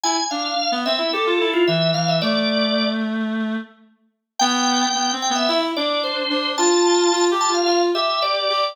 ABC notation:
X:1
M:4/4
L:1/16
Q:1/4=110
K:C
V:1 name="Drawbar Organ"
^g2 f4 e2 A3 F e2 f e | d6 z10 | g6 g e e z d2 c4 | a6 a f f z e2 d4 |]
V:2 name="Clarinet"
E z D2 z B, C E G F E2 E,2 E,2 | A,12 z4 | B,4 (3B,2 C2 B,2 E2 D4 D2 | F4 (3F2 G2 F2 F2 G4 G2 |]